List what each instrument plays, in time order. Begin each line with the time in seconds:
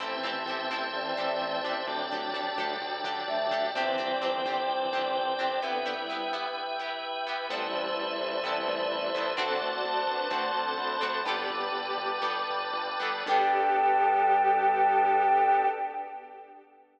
0.00 synth bass 1 A1, violin E3 C4, drawbar organ C4 E4 G4 A4 C5 E5 G5 A5, pizzicato strings C4 E4 G4 A4
0.23 synth bass 1 A1, pizzicato strings C4 E4 G4 A4
0.46 synth bass 1 A1, pizzicato strings C4 E4 G4
0.50 pizzicato strings A4
0.70 synth bass 1 A1, pizzicato strings C4 E4 G4 A4
0.93 synth bass 1 A1, violin E3 C4, flute D5
1.17 synth bass 1 A1, pizzicato strings C4 E4 G4 A4
1.41 synth bass 1 A1
1.64 synth bass 1 A1, pizzicato strings D4 G4 A4
1.86 synth bass 1 D2, violin F#3 D4, drawbar organ D4 G4 A4 D5 G5 A5
2.11 synth bass 1 D2, pizzicato strings D4 G4 A4
2.33 synth bass 1 D2, pizzicato strings D4 G4 A4
2.58 synth bass 1 D2, pizzicato strings D4 G4 A4
2.81 synth bass 1 D2, violin F#3 D4
3.04 synth bass 1 D2, pizzicato strings D4 G4 A4
3.28 synth bass 1 D2, flute E5
3.51 synth bass 1 D2, pizzicato strings D4 G4 A4
3.74 synth bass 1 G1, violin E3 C4, drawbar organ C4 D4 G4 C5 D5 G5, pizzicato strings C4 D4 G4, flute G5
3.98 synth bass 1 G1, pizzicato strings C4 D4 G4
4.22 synth bass 1 G1, pizzicato strings C4 D4 G4
4.45 synth bass 1 G1, pizzicato strings C4 D4 G4
4.68 synth bass 1 G1, violin E3 C4
4.93 synth bass 1 G1, pizzicato strings C4 D4 G4
5.15 synth bass 1 G1
5.39 synth bass 1 G1, pizzicato strings C4 D4 G4
5.62 violin D3 B3, pizzicato strings B3 E4 G4, drawbar organ B3 E4 G4 B4 E5 G5
5.86 pizzicato strings B3 E4 G4
5.97 violin G3 E4
6.09 pizzicato strings B3 E4 G4
6.33 pizzicato strings B3 E4 G4
6.79 pizzicato strings B3 E4 G4
7.27 pizzicato strings B3 E4 G4
7.49 synth bass 1 A1, violin G3 E4, drawbar organ B3 C4 E4 A4 B4 C5 E5 A5, pizzicato strings B3 C4 E4, flute D5
7.54 pizzicato strings A4
7.73 synth bass 1 A1
7.97 synth bass 1 A1
8.21 synth bass 1 A1
8.43 synth bass 1 A1, violin G3 E4, drawbar organ A3 B3 C4 A4, pizzicato strings B3 C4 E4 A4
8.68 synth bass 1 A1
8.91 synth bass 1 A1
9.14 synth bass 1 A1, pizzicato strings B3 C4 E4
9.18 pizzicato strings A4
9.37 synth bass 1 D2, pizzicato strings C4 D4 F#4 A4, drawbar organ C4 D4 F#4 A4 C5 D5 F#5 A5, violin C4 A4
9.61 synth bass 1 D2, violin F#4 D5
9.84 synth bass 1 D2, flute A5
10.07 synth bass 1 D2, violin D4 B4
10.30 synth bass 1 D2, violin A3 F#4, pizzicato strings C4 D4 F#4 A4, drawbar organ C4 D4 A4 C5
10.54 synth bass 1 D2, violin C4 A4
10.78 synth bass 1 D2, flute B5
11.01 synth bass 1 D2, pizzicato strings C4 D4 F#4 A4
11.24 synth bass 1 G1, violin B3 G4, drawbar organ B3 D4 G4 A4 B4 D5 G5 A5, pizzicato strings B3 D4 G4, flute D6
11.29 pizzicato strings A4
11.50 synth bass 1 G1
11.72 synth bass 1 G1
11.97 synth bass 1 G1
12.22 synth bass 1 G1, pizzicato strings B3 D4 G4 A4, drawbar organ B3 D4 A4 B4
12.49 synth bass 1 G1
12.73 synth bass 1 G1
12.99 synth bass 1 G1, pizzicato strings B3 D4 G4 A4
13.26 synth bass 1 G2, pizzicato strings B3 D4 G4, drawbar organ B3 D4 G4 A4, violin G4, flute G5
13.30 pizzicato strings A4